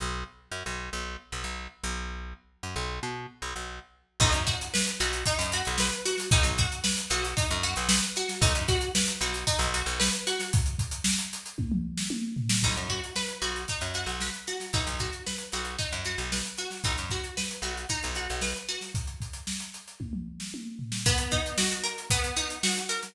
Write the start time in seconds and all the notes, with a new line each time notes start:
0.00 B1
0.52 F#2
0.66 B1
0.93 B1
1.32 B1
1.44 B1
1.84 B1
2.63 F#2
2.76 B1
3.03 B2
3.42 B1
3.56 B1
4.20 B1 D#4, kick, crash
4.32 F#2, closed hi-hat
4.47 F#4, kick, closed hi-hat
4.61 closed hi-hat
4.74 B4, snare
4.87 closed hi-hat
5.00 B1 F#4, closed hi-hat
5.13 closed hi-hat
5.26 D#4, kick, closed hi-hat
5.39 F#2, closed hi-hat
5.52 F#4, closed hi-hat
5.65 B1, closed hi-hat
5.78 B4, snare
5.92 closed hi-hat
6.05 F#4, closed hi-hat
6.17 snare, closed hi-hat
6.31 B1 D#4, kick, closed hi-hat
6.43 B1, closed hi-hat
6.58 F#4, kick, closed hi-hat
6.72 closed hi-hat
6.84 B4, snare
6.97 closed hi-hat
7.10 B1 F#4, closed hi-hat
7.24 closed hi-hat
7.37 D#4, kick, closed hi-hat
7.51 F#2, closed hi-hat
7.63 F#4, snare, closed hi-hat
7.76 B1, closed hi-hat
7.89 B4, snare
8.03 closed hi-hat
8.16 F#4, closed hi-hat
8.29 snare, closed hi-hat
8.41 B1 D#4, kick, closed hi-hat
8.55 F#2, closed hi-hat
8.68 F#4, kick, snare, closed hi-hat
8.81 closed hi-hat
8.95 B4, snare
9.08 closed hi-hat
9.21 B1 F#4, closed hi-hat
9.34 closed hi-hat
9.47 D#4, kick, closed hi-hat
9.59 B1, snare, closed hi-hat
9.74 F#4, closed hi-hat
9.86 B1, closed hi-hat
9.99 B4, snare
10.13 closed hi-hat
10.27 F#4, closed hi-hat
10.39 snare, closed hi-hat
10.53 kick, closed hi-hat
10.66 closed hi-hat
10.79 kick, closed hi-hat
10.91 closed hi-hat
11.04 snare
11.18 closed hi-hat
11.33 closed hi-hat
11.46 closed hi-hat
11.58 kick, high tom
11.72 mid tom
11.97 snare
12.10 high tom
12.37 floor tom
12.49 snare
12.63 B1 D#4, kick, crash
12.76 F#2, closed hi-hat
12.89 F#4, kick, closed hi-hat
13.04 closed hi-hat
13.16 B4, snare
13.29 closed hi-hat
13.42 B1 F#4, closed hi-hat
13.56 closed hi-hat
13.68 D#4, kick, closed hi-hat
13.81 F#2, closed hi-hat
13.94 F#4, closed hi-hat
14.06 B1, closed hi-hat
14.20 B4, snare
14.34 closed hi-hat
14.47 F#4, closed hi-hat
14.60 snare, closed hi-hat
14.73 B1 D#4, kick, closed hi-hat
14.86 B1, closed hi-hat
14.99 F#4, kick, closed hi-hat
15.13 closed hi-hat
15.26 B4, snare
15.38 closed hi-hat
15.52 B1 F#4, closed hi-hat
15.65 closed hi-hat
15.78 D#4, kick, closed hi-hat
15.92 F#2, closed hi-hat
16.04 F#4, snare, closed hi-hat
16.18 B1, closed hi-hat
16.32 B4, snare
16.45 closed hi-hat
16.57 F#4, closed hi-hat
16.70 snare, closed hi-hat
16.84 B1 D#4, kick, closed hi-hat
16.97 F#2, closed hi-hat
17.10 F#4, kick, snare, closed hi-hat
17.24 closed hi-hat
17.37 B4, snare
17.51 closed hi-hat
17.62 B1 F#4, closed hi-hat
17.77 closed hi-hat
17.89 D#4, kick, closed hi-hat
18.03 B1, snare, closed hi-hat
18.15 F#4, closed hi-hat
18.29 B1, closed hi-hat
18.41 B4, snare
18.55 closed hi-hat
18.68 F#4, closed hi-hat
18.81 snare, closed hi-hat
18.95 kick, closed hi-hat
19.07 closed hi-hat
19.21 kick, closed hi-hat
19.33 closed hi-hat
19.47 snare
19.60 closed hi-hat
19.74 closed hi-hat
19.88 closed hi-hat
20.00 kick, high tom
20.13 mid tom
20.40 snare
20.54 high tom
20.79 floor tom
20.92 snare
21.06 B3, kick, closed hi-hat
21.18 closed hi-hat
21.31 D#4, kick, closed hi-hat
21.46 closed hi-hat
21.58 F#4, snare
21.71 closed hi-hat
21.83 A#4, closed hi-hat
21.98 closed hi-hat
22.10 B3, kick, closed hi-hat
22.24 closed hi-hat
22.36 D#4, closed hi-hat
22.50 closed hi-hat
22.63 F#4, snare
22.77 closed hi-hat
22.89 A#4, closed hi-hat
23.03 snare, closed hi-hat